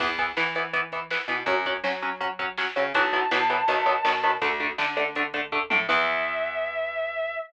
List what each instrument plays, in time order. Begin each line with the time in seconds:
0.00 electric bass (finger) E2, overdriven guitar E3 B3, kick, crash
0.18 overdriven guitar E3 B3, kick, closed hi-hat
0.37 overdriven guitar E3 B3, electric bass (finger) E3, snare
0.55 overdriven guitar E3 B3, closed hi-hat
0.73 overdriven guitar E3 B3, kick, closed hi-hat
0.92 overdriven guitar E3 B3, kick, closed hi-hat
1.11 overdriven guitar E3 B3, snare
1.28 electric bass (finger) B2, overdriven guitar E3 B3, closed hi-hat
1.46 electric bass (finger) F#2, overdriven guitar F#3 C#4, kick, closed hi-hat
1.66 overdriven guitar F#3 C#4, kick, closed hi-hat
1.84 electric bass (finger) F#3, overdriven guitar F#3 C#4, snare
2.02 overdriven guitar F#3 C#4, closed hi-hat
2.20 overdriven guitar F#3 C#4, kick, closed hi-hat
2.39 overdriven guitar F#3 C#4, kick, closed hi-hat
2.58 overdriven guitar F#3 C#4, snare
2.76 electric bass (finger) C#3, overdriven guitar F#3 C#4, closed hi-hat
2.94 electric bass (finger) B1, overdriven guitar E3 F#3 B3, distortion guitar A5, kick, closed hi-hat
3.13 overdriven guitar E3 F#3 B3, kick, closed hi-hat
3.31 electric bass (finger) B2, overdriven guitar E3 F#3 B3, snare
3.50 overdriven guitar E3 F#3 B3, closed hi-hat
3.68 electric bass (finger) B1, overdriven guitar D#3 F#3 B3, kick, closed hi-hat
3.86 overdriven guitar D#3 F#3 B3, kick, closed hi-hat
4.05 electric bass (finger) B2, overdriven guitar D#3 F#3 B3, snare
4.23 overdriven guitar D#3 F#3 B3, closed hi-hat
4.42 electric bass (finger) D2, overdriven guitar D3 A3, kick, closed hi-hat
4.60 overdriven guitar D3 A3, kick, closed hi-hat
4.78 overdriven guitar D3 A3, electric bass (finger) D3, snare
4.97 overdriven guitar D3 A3, closed hi-hat
5.15 overdriven guitar D3 A3, kick, closed hi-hat
5.34 overdriven guitar D3 A3, kick, closed hi-hat
5.52 overdriven guitar D3 A3, kick, floor tom
5.70 electric bass (finger) A2, overdriven guitar D3 A3, high tom
5.89 electric bass (finger) E2, overdriven guitar E3 B3, distortion guitar E5, kick, crash